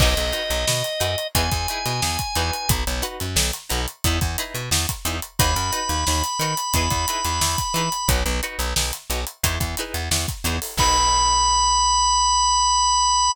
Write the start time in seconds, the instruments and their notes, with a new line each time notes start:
0.00 electric bass (finger) B1, pizzicato strings D#4 F#4 B4, drawbar organ D#5, kick, crash
0.17 electric bass (finger) B1, snare, closed hi-hat
0.32 pizzicato strings D#4 F#4 B4, snare, closed hi-hat
0.50 electric bass (finger) B1, snare, closed hi-hat
0.68 electric bass (finger) B2, snare
0.84 closed hi-hat
1.00 electric bass (finger) F#2, pizzicato strings D#4 F#4 B4, closed hi-hat
1.18 closed hi-hat
1.35 electric bass (finger) E2, pizzicato strings D#4 E4 G#4 B4, drawbar organ G#5, kick, closed hi-hat
1.51 electric bass (finger) E2, kick, closed hi-hat
1.68 pizzicato strings D#4 E4 G#4 B4, closed hi-hat
1.86 electric bass (finger) B2, snare, closed hi-hat
2.02 electric bass (finger) E2, snare
2.19 kick, closed hi-hat
2.35 electric bass (finger) E2, pizzicato strings D#4 F#4 B4, closed hi-hat
2.53 closed hi-hat
2.69 electric bass (finger) B1, kick, closed hi-hat
2.87 electric bass (finger) B1, closed hi-hat
3.02 pizzicato strings D#4 F#4 B4, closed hi-hat
3.20 electric bass (finger) F#2, closed hi-hat
3.36 electric bass (finger) B1, snare
3.53 closed hi-hat
3.70 electric bass (finger) B1, pizzicato strings D#4 F#4 B4, closed hi-hat
3.88 closed hi-hat
4.04 electric bass (finger) E2, pizzicato strings D#4 E4 G#4 B4, kick, closed hi-hat
4.21 electric bass (finger) E2, kick, closed hi-hat
4.38 pizzicato strings D#4 E4 G#4 B4, snare, closed hi-hat
4.54 electric bass (finger) B2, closed hi-hat
4.71 electric bass (finger) E2, snare
4.89 kick, closed hi-hat
5.05 electric bass (finger) E2, pizzicato strings D#4 E4 G#4 B4, closed hi-hat
5.22 closed hi-hat
5.39 electric bass (finger) D#2, pizzicato strings D#4 F#4 B4, drawbar organ B5, kick, closed hi-hat
5.56 electric bass (finger) F#2, snare, closed hi-hat
5.72 pizzicato strings D#4 F#4 B4, closed hi-hat
5.89 electric bass (finger) D#2, closed hi-hat
6.07 electric bass (finger) D#2, snare
6.24 closed hi-hat
6.39 electric bass (finger) D#3, pizzicato strings D#4 F#4 B4, closed hi-hat
6.57 closed hi-hat
6.74 electric bass (finger) E2, pizzicato strings D#4 E4 G#4 B4, kick, closed hi-hat
6.90 electric bass (finger) E2, kick, closed hi-hat
7.08 pizzicato strings D#4 E4 G#4 B4, closed hi-hat
7.25 electric bass (finger) E2, closed hi-hat
7.41 electric bass (finger) E2, snare
7.58 kick, closed hi-hat
7.74 electric bass (finger) E3, pizzicato strings D#4 E4 G#4 B4, closed hi-hat
7.92 closed hi-hat
8.08 electric bass (finger) B1, pizzicato strings D#4 F#4 B4, kick, closed hi-hat
8.26 electric bass (finger) B1, closed hi-hat
8.43 pizzicato strings D#4 F#4 B4, closed hi-hat
8.59 electric bass (finger) B1, closed hi-hat
8.76 electric bass (finger) B1, snare
8.93 closed hi-hat
9.10 electric bass (finger) B1, pizzicato strings D#4 F#4 B4, closed hi-hat
9.27 closed hi-hat
9.44 electric bass (finger) E2, pizzicato strings D#4 E4 G#4 B4, kick, closed hi-hat
9.60 electric bass (finger) E2, kick, closed hi-hat
9.77 pizzicato strings D#4 E4 G#4 B4, snare, closed hi-hat
9.94 electric bass (finger) E2, closed hi-hat
10.11 electric bass (finger) E2, snare
10.28 kick, closed hi-hat
10.44 electric bass (finger) E2, pizzicato strings D#4 E4 G#4 B4, closed hi-hat
10.62 open hi-hat
10.77 electric bass (finger) B1, pizzicato strings D#4 F#4 B4, drawbar organ B5, kick, crash